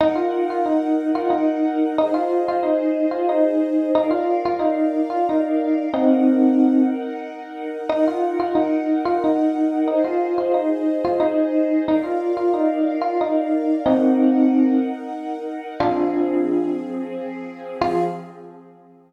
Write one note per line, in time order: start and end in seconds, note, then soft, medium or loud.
0.00 1.96 D#4 medium
0.00 0.16 D#4 loud
0.00 1.96 A#4 medium
0.00 1.96 F#5 medium
0.15 0.44 F4 medium
0.50 0.66 F4 medium
0.66 1.11 D#4 medium
1.15 1.31 F4 medium
1.30 1.93 D#4 medium
1.98 2.14 D#4 medium
1.98 3.94 G#4 medium
1.98 3.94 C5 medium
1.98 3.94 D#5 medium
2.14 2.43 F4 medium
2.48 2.64 F4 medium
2.63 3.06 D#4 medium
3.11 3.27 F4 medium
3.29 3.91 D#4 medium
3.95 4.11 D#4 medium
3.95 5.91 A#4 medium
3.95 5.91 D5 medium
3.95 5.91 F5 medium
4.11 4.40 F4 medium
4.45 4.61 F4 medium
4.59 5.01 D#4 medium
5.10 5.26 F4 medium
5.29 5.85 D#4 medium
5.93 6.82 C4 medium
5.93 7.89 D#4 medium
5.93 6.82 D#4 medium
5.93 7.89 A#4 medium
5.93 7.89 F#5 medium
7.89 8.05 D#4 loud
7.89 9.87 D#4 medium
7.89 9.87 A#4 medium
7.89 9.87 F#5 medium
8.08 8.36 F4 medium
8.40 8.55 F4 medium
8.55 9.00 D#4 medium
9.05 9.21 F4 medium
9.24 9.87 D#4 medium
9.88 10.03 D#4 medium
9.88 11.85 G#4 medium
9.88 11.85 C5 medium
9.88 11.85 D#5 medium
10.04 10.34 F4 medium
10.38 10.54 F4 medium
10.54 10.97 D#4 medium
11.05 11.20 F4 medium
11.20 11.82 D#4 medium
11.87 12.04 D#4 medium
11.87 13.83 A#4 medium
11.87 13.83 D5 medium
11.87 13.83 F5 medium
12.03 12.32 F4 medium
12.37 12.53 F4 medium
12.54 12.95 D#4 medium
13.02 13.17 F4 medium
13.21 13.77 D#4 medium
13.85 14.75 C4 medium
13.85 15.80 D#4 medium
13.85 14.75 D#4 medium
13.85 15.80 A#4 medium
13.85 15.80 F#5 medium
15.80 17.78 F3 medium
15.80 17.78 C4 medium
15.80 16.69 D4 medium
15.80 16.69 F4 medium
15.80 17.78 G#4 medium
17.80 18.03 F3 loud
17.80 18.03 C4 medium
17.80 18.05 F4 loud
17.80 18.03 G#4 loud